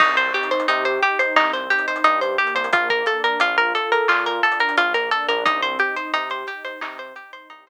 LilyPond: <<
  \new Staff \with { instrumentName = "Pizzicato Strings" } { \time 4/4 \key c \minor \tempo 4 = 88 ees'16 c''16 g'16 c''16 ees'16 c''16 g'16 c''16 ees'16 c''16 g'16 c''16 ees'16 c''16 g'16 c''16 | f'16 bes'16 a'16 bes'16 f'16 bes'16 a'16 bes'16 f'16 bes'16 a'16 bes'16 f'16 bes'16 a'16 bes'16 | ees'16 c''16 g'16 c''16 ees'16 c''16 g'16 c''16 ees'16 c''16 g'16 c''16 ees'16 c''16 r8 | }
  \new Staff \with { instrumentName = "Pad 2 (warm)" } { \time 4/4 \key c \minor c'8 ees'8 g'8 ees'8 c'8 ees'8 g'8 bes8~ | bes8 d'8 f'8 a'8 f'8 d'8 bes8 d'8 | c'8 ees'8 g'8 ees'8 c'8 ees'8 g'8 r8 | }
  \new Staff \with { instrumentName = "Synth Bass 1" } { \clef bass \time 4/4 \key c \minor c,4 c4 c,4 g,8. c,16 | bes,,4 bes,,4 bes,4 bes,,8. bes,,16 | c,4 c4 c4 c,8. r16 | }
  \new DrumStaff \with { instrumentName = "Drums" } \drummode { \time 4/4 <cymc bd>16 hh16 hh32 hh32 hh32 hh32 hh16 hh16 hh16 hh16 hc16 hh16 hh32 hh32 hh32 hh32 hh16 hh16 hh32 hh32 hh32 hh32 | <hh bd>16 <hh bd>16 hh16 hh16 hh16 hh16 hh16 hh16 hc16 hh16 hh32 hh32 hh32 hh32 hh16 hh16 hh16 hh16 | <hh bd>16 hh16 hh16 hh16 hh16 hh16 hh16 hh16 hc16 hh16 hh16 hh16 hh16 hh8. | }
>>